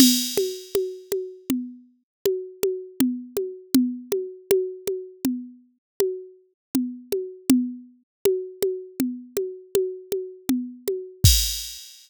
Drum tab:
CC |x---------|----------|----------|x---------|
CG |OoooO-ooOo|OoooO-o-Oo|O-ooOoooOo|----------|
BD |----------|----------|----------|o---------|